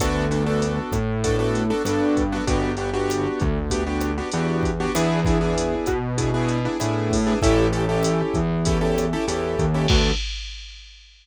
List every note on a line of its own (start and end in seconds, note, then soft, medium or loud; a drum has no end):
0.00 0.79 D2 medium
0.00 0.26 B3 loud
0.00 0.26 D4 loud
0.00 0.26 F#4 loud
0.00 0.26 A4 loud
0.00 kick medium
0.00 cross-stick medium
0.00 closed hi-hat medium
0.31 0.43 B3 medium
0.31 0.43 D4 medium
0.31 0.43 F#4 loud
0.31 0.43 A4 medium
0.31 closed hi-hat medium
0.46 0.96 B3 loud
0.46 0.96 D4 loud
0.46 0.96 F#4 loud
0.46 0.96 A4 loud
0.62 closed hi-hat medium
0.92 1.71 A2 medium
0.92 kick medium
0.92 cross-stick medium
0.92 closed hi-hat medium
1.24 1.36 B3 medium
1.24 1.36 D4 loud
1.24 1.36 F#4 loud
1.24 1.36 A4 loud
1.24 kick medium
1.24 closed hi-hat medium
1.39 1.64 B3 loud
1.39 1.64 D4 loud
1.39 1.64 F#4 loud
1.39 1.64 A4 loud
1.55 closed hi-hat medium
1.70 1.82 B3 loud
1.70 1.82 D4 loud
1.70 1.82 F#4 loud
1.70 1.82 A4 loud
1.85 2.38 G2 medium
1.85 2.23 B3 loud
1.85 2.23 D4 loud
1.85 2.23 F#4 loud
1.85 2.23 A4 loud
1.85 cross-stick medium
1.85 closed hi-hat medium
2.17 kick medium
2.17 closed hi-hat medium
2.32 2.45 B3 loud
2.32 2.45 D4 loud
2.32 2.45 F#4 loud
2.32 2.45 A4 medium
2.47 3.27 G1 medium
2.47 2.72 B3 loud
2.47 2.72 D4 loud
2.47 2.72 F#4 loud
2.47 2.72 G4 loud
2.47 kick medium
2.47 closed hi-hat medium
2.77 2.90 B3 medium
2.77 2.90 D4 loud
2.77 2.90 F#4 loud
2.77 2.90 G4 loud
2.77 closed hi-hat medium
2.93 3.43 B3 loud
2.93 3.43 D4 loud
2.93 3.43 F#4 loud
2.93 3.43 G4 loud
3.10 cross-stick medium
3.10 closed hi-hat medium
3.40 4.20 D2 medium
3.40 kick medium
3.40 closed hi-hat medium
3.70 3.83 B3 loud
3.70 3.83 D4 loud
3.70 3.83 F#4 loud
3.70 3.83 G4 loud
3.70 kick medium
3.70 closed hi-hat medium
3.86 4.11 B3 loud
3.86 4.11 D4 loud
3.86 4.11 F#4 medium
3.86 4.11 G4 medium
4.01 cross-stick medium
4.01 closed hi-hat medium
4.18 4.30 B3 loud
4.18 4.30 D4 loud
4.18 4.30 F#4 medium
4.18 4.30 G4 medium
4.32 4.86 E2 medium
4.32 4.71 B3 loud
4.32 4.71 D4 loud
4.32 4.71 F#4 loud
4.32 4.71 G4 loud
4.32 closed hi-hat medium
4.63 kick medium
4.63 closed hi-hat medium
4.80 4.92 B3 loud
4.80 4.92 D4 loud
4.80 4.92 F#4 loud
4.80 4.92 G4 loud
4.95 5.74 E2 medium
4.95 5.20 B3 loud
4.95 5.20 D4 loud
4.95 5.20 E4 loud
4.95 5.20 G#4 loud
4.95 cross-stick medium
4.95 closed hi-hat loud
5.25 5.38 B3 medium
5.25 5.38 D4 medium
5.25 5.38 E4 loud
5.25 5.38 G#4 loud
5.25 kick medium
5.25 closed hi-hat medium
5.41 5.90 B3 loud
5.41 5.90 D4 medium
5.41 5.90 E4 loud
5.41 5.90 G#4 loud
5.58 closed hi-hat loud
5.86 6.66 B2 medium
5.86 kick medium
5.86 cross-stick medium
5.86 closed hi-hat medium
6.18 6.30 B3 loud
6.18 6.30 D4 medium
6.18 6.30 E4 medium
6.18 6.30 G#4 medium
6.18 kick medium
6.18 closed hi-hat medium
6.34 6.59 B3 loud
6.34 6.59 D4 medium
6.34 6.59 E4 loud
6.34 6.59 G#4 loud
6.48 closed hi-hat medium
6.65 6.77 B3 loud
6.65 6.77 D4 loud
6.65 6.77 E4 loud
6.65 6.77 G#4 medium
6.80 7.34 A2 medium
6.80 7.17 B3 medium
6.80 7.17 D4 medium
6.80 7.17 E4 loud
6.80 7.17 G#4 medium
6.80 cross-stick medium
6.80 closed hi-hat medium
7.11 kick medium
7.11 open hi-hat medium
7.27 7.39 B3 loud
7.27 7.39 D4 loud
7.27 7.39 E4 loud
7.27 7.39 G#4 loud
7.42 8.22 A1 loud
7.42 7.67 C#4 loud
7.42 7.67 E4 loud
7.42 7.67 G4 loud
7.42 7.67 A4 loud
7.42 kick medium
7.42 closed hi-hat loud
7.73 7.85 C#4 medium
7.73 7.85 E4 medium
7.73 7.85 G4 loud
7.73 7.85 A4 loud
7.73 closed hi-hat medium
7.89 8.38 C#4 loud
7.89 8.38 E4 loud
7.89 8.38 G4 loud
7.89 8.38 A4 loud
8.03 cross-stick medium
8.03 closed hi-hat loud
8.34 9.14 E2 medium
8.34 kick medium
8.34 closed hi-hat medium
8.65 8.78 C#4 loud
8.65 8.78 E4 loud
8.65 8.78 G4 medium
8.65 8.78 A4 loud
8.65 kick medium
8.65 closed hi-hat loud
8.81 9.06 C#4 loud
8.81 9.06 E4 loud
8.81 9.06 G4 medium
8.81 9.06 A4 loud
8.98 cross-stick medium
8.98 closed hi-hat medium
9.13 9.25 C#4 loud
9.13 9.25 E4 loud
9.13 9.25 G4 loud
9.13 9.25 A4 loud
9.28 9.56 E2 medium
9.28 9.65 C#4 medium
9.28 9.65 E4 loud
9.28 9.65 G4 medium
9.28 9.65 A4 loud
9.28 closed hi-hat loud
9.59 9.87 D#2 medium
9.59 kick medium
9.59 closed hi-hat medium
9.74 9.87 C#4 loud
9.74 9.87 E4 loud
9.74 9.87 G4 loud
9.74 9.87 A4 loud
9.88 10.11 D2 loud
9.88 10.11 B3 loud
9.88 10.11 D4 loud
9.88 10.11 F#4 medium
9.88 10.11 A4 loud
9.88 kick loud
9.88 crash loud